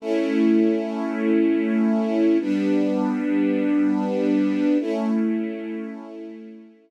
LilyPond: \new Staff { \time 12/8 \key a \mixolydian \tempo 4. = 100 <a cis' e'>1. | <g b d'>1. | <a cis' e'>1. | }